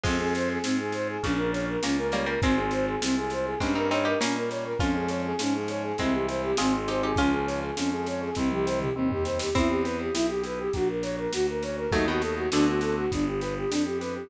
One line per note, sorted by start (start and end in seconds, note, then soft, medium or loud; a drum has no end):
0.04 0.58 F2 loud
0.04 1.14 F3 medium
0.04 1.14 G#3 medium
0.04 0.18 C4 medium
0.04 0.58 C4 loud
0.04 0.58 F4 loud
0.04 0.58 G#4 loud
0.04 kick medium
0.04 snare medium
0.04 crash medium
0.19 0.33 G#4 medium
0.35 0.49 C5 medium
0.35 snare medium
0.50 0.63 G#4 medium
0.63 1.17 G#2 medium
0.63 0.77 C4 medium
0.63 1.18 C4 medium
0.63 1.18 F4 medium
0.63 1.18 G#4 loud
0.63 snare medium
0.79 0.93 G#4 medium
0.92 1.08 C5 medium
0.92 snare medium
1.09 1.22 G#4 medium
1.23 1.77 A#1 loud
1.23 1.78 A#2 soft
1.23 1.78 C#3 medium
1.23 1.77 A#3 loud
1.23 1.77 C#4 loud
1.23 1.37 C#4 medium
1.23 1.77 F4 loud
1.23 kick medium
1.23 snare medium
1.38 1.51 A#4 medium
1.52 1.66 C#5 medium
1.52 snare medium
1.69 1.83 A#4 medium
1.82 2.36 C#2 medium
1.82 2.36 A#3 medium
1.82 2.11 A#3 medium
1.82 2.36 C#4 medium
1.82 1.96 C#4 medium
1.82 2.11 C#4 medium
1.82 2.36 F4 medium
1.82 snare medium
1.98 2.11 A#4 medium
2.12 2.26 G3 medium
2.12 2.26 A#3 medium
2.12 2.26 C#5 medium
2.12 snare medium
2.26 2.40 G3 medium
2.26 2.40 A#3 medium
2.26 2.41 A#4 medium
2.42 2.96 G#1 loud
2.42 2.96 G#3 loud
2.42 3.50 G#3 medium
2.42 2.96 C4 loud
2.42 2.56 C4 medium
2.42 3.50 C4 medium
2.42 2.96 F4 loud
2.42 kick medium
2.42 snare medium
2.57 2.70 G#4 medium
2.71 2.86 C5 medium
2.71 snare medium
2.88 3.01 G#4 medium
3.01 3.55 C2 medium
3.01 3.55 G#3 medium
3.01 3.55 C4 medium
3.01 3.16 C4 medium
3.01 3.55 F4 loud
3.01 snare loud
3.17 3.31 G#4 medium
3.30 3.46 C5 medium
3.30 snare medium
3.45 3.59 G#4 medium
3.60 4.14 G2 loud
3.60 4.14 G3 loud
3.60 3.75 G#3 medium
3.60 4.14 A#3 loud
3.60 3.75 C4 medium
3.60 4.14 C#4 loud
3.60 3.75 C#4 medium
3.60 kick medium
3.60 snare medium
3.75 3.89 C4 medium
3.75 3.89 D#4 medium
3.75 3.90 A#4 medium
3.91 4.05 C4 medium
3.91 4.04 D#4 medium
3.91 4.05 C#5 medium
3.91 snare medium
4.05 4.19 D#4 medium
4.05 4.19 G4 medium
4.05 4.20 A#4 medium
4.20 4.74 A#2 medium
4.20 4.74 G3 loud
4.20 4.49 A#3 medium
4.20 4.74 A#3 medium
4.20 4.34 C#4 medium
4.20 4.49 C#4 medium
4.20 4.74 C#4 medium
4.20 snare loud
4.36 4.50 A#4 medium
4.50 4.64 C#5 medium
4.50 snare medium
4.64 4.78 A#4 medium
4.79 5.33 F2 loud
4.79 5.33 F3 loud
4.79 5.33 G#3 loud
4.79 5.33 C#4 loud
4.79 4.93 C#4 medium
4.79 5.93 C#4 medium
4.79 5.93 F4 medium
4.79 kick medium
4.79 snare medium
4.95 5.09 G#4 medium
5.09 5.22 C#5 medium
5.09 snare medium
5.25 5.39 G#4 medium
5.39 5.93 G#2 medium
5.39 5.93 F3 medium
5.39 5.93 G#3 loud
5.39 5.93 C#4 medium
5.39 5.54 C#4 medium
5.39 snare medium
5.55 5.68 G#4 medium
5.68 5.83 C#5 medium
5.68 snare medium
5.83 5.97 G#4 medium
5.98 6.53 C2 loud
5.98 6.52 E3 loud
5.98 6.52 G3 loud
5.98 6.52 G#3 medium
5.98 6.52 C4 loud
5.98 6.52 C4 medium
5.98 6.14 C4 medium
5.98 kick medium
5.98 snare medium
6.13 6.26 G4 medium
6.28 6.42 C5 medium
6.28 snare medium
6.43 6.57 G4 medium
6.57 7.13 G#1 loud
6.57 7.12 D#3 loud
6.57 7.12 G#3 loud
6.57 7.12 C4 loud
6.57 6.73 C4 medium
6.57 6.87 F4 medium
6.57 6.87 G#4 medium
6.57 snare loud
6.74 6.88 G#4 medium
6.88 7.02 D#4 medium
6.88 7.02 G4 medium
6.88 7.02 C5 medium
6.88 snare medium
7.03 7.18 D#4 medium
7.03 7.18 G4 medium
7.03 7.17 G#4 medium
7.16 7.71 C#2 loud
7.16 7.71 F3 loud
7.16 7.71 G#3 loud
7.16 7.71 C#4 loud
7.16 7.31 C#4 medium
7.16 7.74 C#4 medium
7.16 7.74 F4 medium
7.16 kick medium
7.16 snare medium
7.32 7.46 G#4 medium
7.47 7.60 C#5 medium
7.47 snare medium
7.62 7.76 G#4 medium
7.77 8.30 F2 medium
7.77 8.31 F3 medium
7.77 8.31 G#3 loud
7.77 7.90 C#4 medium
7.77 8.31 C#4 medium
7.77 snare medium
7.92 8.05 G#4 medium
8.06 8.21 C#5 medium
8.06 snare medium
8.22 8.35 G#4 medium
8.35 8.90 C2 loud
8.35 8.90 D#3 loud
8.35 8.90 G3 loud
8.35 8.49 C4 medium
8.35 8.90 C4 loud
8.35 kick medium
8.35 snare medium
8.51 8.66 G4 medium
8.51 high tom medium
8.66 8.79 C5 medium
8.66 snare medium
8.80 8.94 G4 medium
8.80 mid tom medium
8.95 9.49 D#2 medium
8.95 9.49 D#3 medium
8.95 9.49 G3 medium
8.95 9.09 C4 medium
8.95 9.49 C4 loud
9.10 9.24 G4 medium
9.10 floor tom medium
9.25 9.38 C5 medium
9.25 snare medium
9.39 9.54 G4 medium
9.39 snare medium
9.55 10.09 E2 loud
9.55 10.14 B3 medium
9.55 11.19 C4 medium
9.55 9.68 E4 medium
9.55 11.19 E4 medium
9.55 kick medium
9.55 snare medium
9.69 9.83 G4 medium
9.84 10.69 G4 medium
9.84 9.98 B4 medium
9.84 snare medium
10.00 10.14 G4 medium
10.13 10.68 B1 medium
10.13 10.71 B3 medium
10.13 10.27 E4 medium
10.13 snare medium
10.28 10.42 G4 medium
10.44 10.73 E4 medium
10.44 10.59 B4 medium
10.44 snare medium
10.59 10.73 G4 medium
10.73 11.27 A#1 medium
10.73 11.33 A#3 medium
10.73 10.88 F#4 medium
10.73 kick medium
10.73 snare medium
10.89 11.03 A#4 medium
11.03 11.89 F#4 medium
11.03 11.16 C#5 medium
11.03 snare medium
11.18 11.32 A#4 medium
11.33 11.87 D2 medium
11.33 11.90 A#3 medium
11.33 11.47 F#4 medium
11.33 snare medium
11.49 11.63 A#4 medium
11.63 11.92 C#4 medium
11.63 11.77 C#5 medium
11.63 snare medium
11.77 11.91 A#4 medium
11.92 12.47 D#2 loud
11.92 12.07 F#3 medium
11.92 12.07 A3 medium
11.92 12.46 A3 medium
11.92 12.46 B3 medium
11.92 12.46 D#4 loud
11.92 12.06 D#4 medium
11.92 12.46 F#4 medium
11.92 kick medium
11.92 snare medium
12.08 12.22 B2 medium
12.08 12.22 D#3 medium
12.08 12.22 F#4 medium
12.21 12.35 A4 medium
12.21 snare medium
12.36 12.50 F#4 medium
12.52 13.07 D2 medium
12.52 13.01 B2 medium
12.52 13.01 D3 medium
12.52 13.05 A3 loud
12.52 13.05 C4 loud
12.52 13.05 D4 medium
12.52 12.66 D4 medium
12.52 13.05 F#4 loud
12.52 snare medium
12.68 12.81 F#4 medium
12.81 12.96 A4 medium
12.81 snare medium
12.98 13.11 F#4 medium
13.11 13.65 G1 medium
13.11 13.70 B3 medium
13.11 13.26 D4 medium
13.11 kick medium
13.11 snare medium
13.27 13.41 G4 medium
13.40 14.26 G4 medium
13.40 13.54 B4 medium
13.40 snare medium
13.57 13.71 G4 medium
13.70 14.24 F2 medium
13.70 14.27 B3 medium
13.70 13.84 D4 medium
13.70 snare medium
13.85 13.99 G4 medium
14.01 14.29 D4 medium
14.01 14.14 B4 medium
14.01 snare medium
14.15 14.29 G4 medium